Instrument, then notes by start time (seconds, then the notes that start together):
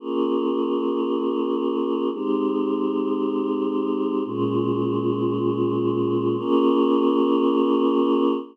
choir aahs
0.00 A#3 C#4 F4 G#4
2.12 G#3 C4 D#4 G4
4.25 A#2 G#3 C#4 F4
6.37 A#3 C#4 F4 G#4